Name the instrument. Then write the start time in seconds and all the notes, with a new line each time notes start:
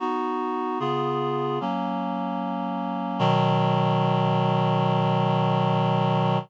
clarinet
0.00 B3 D#4 F#4
0.80 C#3 B3 F4 G#4
1.61 F#3 A#3 C#4
3.19 B2 D#3 F#3